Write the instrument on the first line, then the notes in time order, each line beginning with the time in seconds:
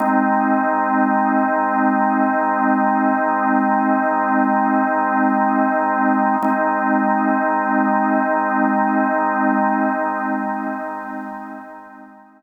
drawbar organ
0.00 G#3 C4 D#4
6.42 G#3 C4 D#4